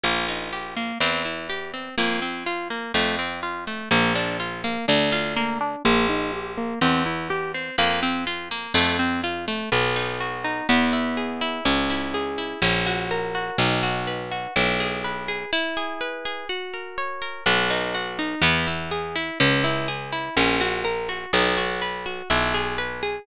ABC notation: X:1
M:2/2
L:1/8
Q:1/2=62
K:Bb
V:1 name="Acoustic Guitar (steel)"
B, E G B, C =E G C | B, C F B, A, C F A, | B, D F B, D F B, D | B, E G B, C =E G C |
B, C F B, A, C F A, | [K:B] B, D F D B, E G E | C E G E C F A F | D F B F E G B G |
E G B G F A c A | B, D F D B, E G E | C E G E C F A F | D F B F E G B G |]
V:2 name="Harpsichord" clef=bass
B,,,4 =E,,4 | F,,4 F,,4 | B,,,4 D,,4 | B,,,4 =E,,4 |
F,,4 F,,4 | [K:B] B,,,4 E,,4 | C,,4 A,,,4 | B,,,4 B,,,4 |
z8 | B,,,4 E,,4 | C,,4 A,,,4 | B,,,4 B,,,4 |]